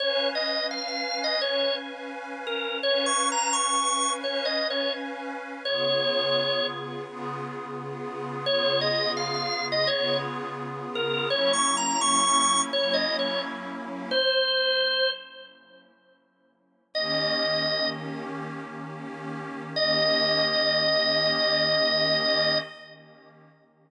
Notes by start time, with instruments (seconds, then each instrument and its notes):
0.00 pad 5 (bowed) C#4 B4 F5 G#5, drawbar organ C#5
0.35 drawbar organ D#5
0.71 drawbar organ F5
0.88 drawbar organ F5
1.24 drawbar organ D#5
1.40 pad 5 (bowed) C#4 B4 F5 G#5, drawbar organ C#5
2.47 drawbar organ A#4
2.82 pad 5 (bowed) C#4 B4 F5 G#5, drawbar organ C#5
3.06 drawbar organ C#6
3.32 drawbar organ A#5
3.53 drawbar organ C#6
4.22 pad 5 (bowed) C#4 B4 F5 G#5, drawbar organ C#5
4.45 drawbar organ D#5
4.70 drawbar organ C#5
5.65 pad 5 (bowed) C#3 B3 F4 G#4, drawbar organ C#5
7.06 pad 5 (bowed) C#3 B3 F4 G#4
8.45 pad 5 (bowed) C#3 B3 F4 G#4, drawbar organ C#5
8.81 drawbar organ D#5
9.17 drawbar organ F5
9.35 drawbar organ F5
9.72 drawbar organ D#5
9.87 pad 5 (bowed) C#3 B3 F4 G#4, drawbar organ C#5
10.95 drawbar organ A#4
11.30 pad 5 (bowed) F#3 A#3 C#4 E4, drawbar organ C#5
11.53 drawbar organ C#6
11.77 drawbar organ A#5
12.01 drawbar organ C#6
12.72 pad 5 (bowed) F#3 A#3 C#4 E4, drawbar organ C#5
12.94 drawbar organ D#5
13.19 drawbar organ C#5
14.11 drawbar organ C5
16.94 pad 5 (bowed) D#3 A#3 C#4 G4, drawbar organ D#5
19.76 pad 5 (bowed) D#3 A#3 C#4 G4, drawbar organ D#5